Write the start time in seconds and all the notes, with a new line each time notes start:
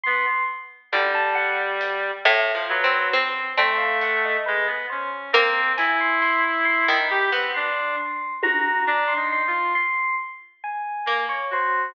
0.03 B3 C6
0.92 D3 G3, high tom
1.15 A5
1.35 F#5
1.81 closed hi-hat
2.25 A2
2.55 F3
2.69 F#3 B4
2.84 C4
3.13 C4
3.57 A3 C4, cowbell
3.78 F5
4.01 F#5, closed hi-hat
4.25 D#5
4.46 G#3 B4
4.67 B3
4.90 C#4 C5
5.33 A#3 C4
5.77 E4 G#5, closed hi-hat
6.00 C6
6.22 C6, snare
6.65 C6
6.88 D#3 B5
7.10 G4
7.31 B3 C4
7.54 D4 C6
8.42 F#4 A#5, high tom
8.87 D4
9.08 C6
9.16 D#4
9.32 C6
9.47 F4
9.75 C6
10.64 G#5
11.06 A#3
11.29 C#5
11.51 F#4 C5